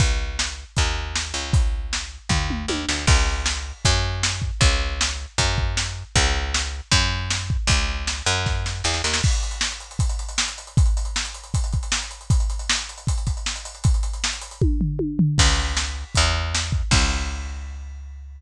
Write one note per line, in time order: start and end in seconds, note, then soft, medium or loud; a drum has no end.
0.00 0.64 C#2 medium
0.00 kick loud
0.00 closed hi-hat loud
0.39 snare loud
0.77 1.33 D#2 medium
0.77 kick medium
0.77 closed hi-hat loud
1.16 snare loud
1.34 2.18 C#2 medium
1.53 kick loud
1.53 closed hi-hat loud
1.93 snare loud
2.29 2.66 D#2 medium
2.29 kick medium
2.29 floor tom medium
2.50 mid tom medium
2.68 2.86 D#2 medium
2.68 high tom medium
2.89 3.06 D2 medium
2.89 snare loud
3.07 3.73 C#2 loud
3.07 kick loud
3.07 crash loud
3.46 snare loud
3.85 4.51 F#2 loud
3.85 kick loud
3.85 closed hi-hat loud
4.23 snare loud
4.42 kick medium
4.61 5.26 C#2 loud
4.61 kick loud
4.61 closed hi-hat loud
5.01 snare loud
5.38 6.04 F#2 loud
5.38 kick medium
5.38 closed hi-hat loud
5.58 kick medium
5.77 snare loud
6.15 6.81 C#2 loud
6.15 kick loud
6.15 closed hi-hat loud
6.54 snare loud
6.92 7.57 F#2 loud
6.92 kick medium
6.92 closed hi-hat loud
7.30 snare loud
7.50 kick medium
7.67 8.22 C#2 loud
7.67 kick loud
7.67 closed hi-hat loud
8.07 snare loud
8.26 8.82 F#2 loud
8.46 kick medium
8.46 snare medium
8.66 snare medium
8.84 9.02 E2 medium
8.84 snare medium
8.94 snare medium
9.04 9.21 D#2 medium
9.04 snare medium
9.14 snare loud
9.23 kick loud
9.23 crash loud
9.33 closed hi-hat medium
9.43 closed hi-hat medium
9.51 closed hi-hat medium
9.61 snare loud
9.71 closed hi-hat medium
9.80 closed hi-hat medium
9.91 closed hi-hat medium
9.99 kick loud
9.99 closed hi-hat loud
10.09 closed hi-hat medium
10.19 closed hi-hat medium
10.29 closed hi-hat medium
10.38 snare loud
10.48 closed hi-hat medium
10.58 closed hi-hat medium
10.67 closed hi-hat medium
10.77 kick loud
10.77 closed hi-hat loud
10.86 closed hi-hat medium
10.97 closed hi-hat medium
11.05 closed hi-hat medium
11.16 snare loud
11.25 closed hi-hat medium
11.34 closed hi-hat medium
11.44 closed hi-hat medium
11.54 kick loud
11.54 closed hi-hat loud
11.64 closed hi-hat medium
11.73 kick medium
11.73 closed hi-hat medium
11.83 closed hi-hat medium
11.92 snare loud
12.02 closed hi-hat medium
12.11 closed hi-hat medium
12.21 closed hi-hat medium
12.30 kick loud
12.30 closed hi-hat loud
12.40 closed hi-hat medium
12.50 closed hi-hat medium
12.59 closed hi-hat medium
12.70 snare loud
12.78 closed hi-hat medium
12.89 closed hi-hat medium
12.98 closed hi-hat medium
13.07 kick loud
13.07 closed hi-hat loud
13.18 closed hi-hat medium
13.27 kick medium
13.27 closed hi-hat medium
13.37 closed hi-hat medium
13.46 snare loud
13.56 closed hi-hat medium
13.65 closed hi-hat medium
13.75 closed hi-hat medium
13.84 kick loud
13.84 closed hi-hat loud
13.94 closed hi-hat medium
14.03 closed hi-hat medium
14.13 closed hi-hat medium
14.24 snare loud
14.33 closed hi-hat medium
14.41 closed hi-hat loud
14.51 closed hi-hat medium
14.62 kick loud
14.62 high tom medium
14.81 floor tom loud
14.99 high tom loud
15.19 floor tom loud
15.38 16.04 C#2 loud
15.38 kick loud
15.38 crash loud
15.77 snare loud
16.15 16.83 E2 loud
16.15 kick medium
16.15 closed hi-hat loud
16.55 snare loud
16.72 kick medium
16.91 18.40 C#2 loud
16.91 kick loud
16.91 crash loud